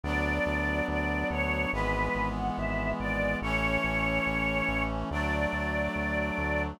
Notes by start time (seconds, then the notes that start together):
0.04 D2 F#3 B3 D4 D5
0.46 D2
0.88 D2 D5
1.30 D2 C#5
1.73 G#1 E3 G#3 B3 B4
2.15 G#1
2.36 F#5
2.57 G#1 E5
3.00 G#1 D5
3.42 A1 E3 A3 C#4 C#5
3.84 A1
4.26 A1
4.68 A1
5.11 D2 F#3 A3 D4 D5
5.53 D2
5.96 D2
6.38 D2